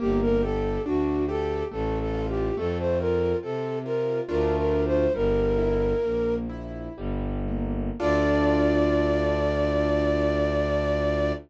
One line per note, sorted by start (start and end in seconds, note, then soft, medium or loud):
0.00 0.78 G1 loud
0.00 0.39 A#3 medium
0.00 0.20 G4 medium
0.22 0.42 A#4 medium
0.43 0.81 G4 medium
0.43 0.82 A4 medium
0.86 1.63 D2 medium
0.86 1.24 D4 medium
0.86 1.26 F#4 medium
1.29 1.67 G4 medium
1.29 1.64 A4 medium
1.71 2.51 A1 loud
1.71 2.10 A3 medium
1.71 1.99 A4 medium
1.99 2.27 A4 medium
2.14 2.53 F4 medium
2.29 2.56 G4 medium
2.57 3.34 F2 loud
2.57 2.96 A3 loud
2.57 2.78 A4 medium
2.79 2.99 C5 medium
3.00 3.39 F4 medium
3.00 3.37 A#4 medium
3.43 4.20 C3 medium
3.43 3.81 C4 medium
3.43 3.79 A4 medium
3.85 4.24 F4 medium
3.85 4.21 A#4 medium
4.28 5.07 D2 loud
4.28 5.06 A3 medium
4.28 5.06 D4 medium
4.28 5.06 F4 medium
4.28 4.56 A#4 medium
4.57 4.84 A#4 medium
4.86 5.13 C5 medium
5.14 5.94 G1 loud
5.14 5.53 G3 medium
5.14 6.35 A#4 medium
5.58 5.98 E4 medium
6.03 6.89 A#1 medium
6.03 6.45 A#3 medium
6.49 6.93 E4 medium
6.97 7.91 G1 loud
6.97 7.43 G3 medium
7.48 7.94 A#3 medium
8.00 11.32 D2 loud
8.00 11.32 D4 loud
8.00 11.32 F4 loud
8.00 11.32 A4 medium
8.00 11.32 D5 loud